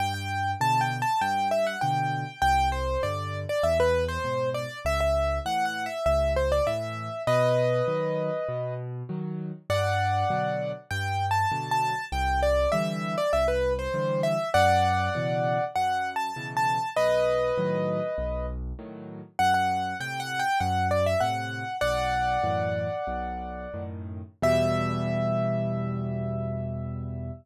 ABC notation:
X:1
M:4/4
L:1/16
Q:1/4=99
K:Em
V:1 name="Acoustic Grand Piano"
g g3 (3a2 g2 a2 g2 e f g4 | g2 c2 d3 d e B2 c3 d2 | e e3 (3f2 f2 e2 e2 c d e4 | [B^d]12 z4 |
[df]8 (3g4 a4 a4 | g2 d2 e3 d e B2 c3 e2 | [df]8 (3f4 a4 a4 | [B^d]12 z4 |
f f3 (3g2 f2 g2 f2 d e f4 | "^rit." [df]14 z2 | e16 |]
V:2 name="Acoustic Grand Piano" clef=bass
G,,4 [B,,D,]4 G,,4 [B,,D,]4 | C,,4 [G,,D,]4 E,,4 [^G,,B,,]4 | ^C,,4 [A,,E,]4 C,,4 [A,,E,]4 | B,,4 [^D,F,]4 B,,4 [D,F,]4 |
G,,4 [B,,D,F,]4 G,,4 [B,,D,F,]4 | C,,4 [D,E,G,]4 C,,4 [D,E,G,]4 | F,,4 [B,,^C,E,]4 F,,4 [B,,C,E,]4 | B,,,4 [A,,^D,F,]4 B,,,4 [A,,D,F,]4 |
F,,4 [A,,C,]4 F,,4 [A,,C,]4 | "^rit." B,,,4 [F,,A,,E,]4 B,,,4 [F,,A,,^D,]4 | [E,,B,,G,]16 |]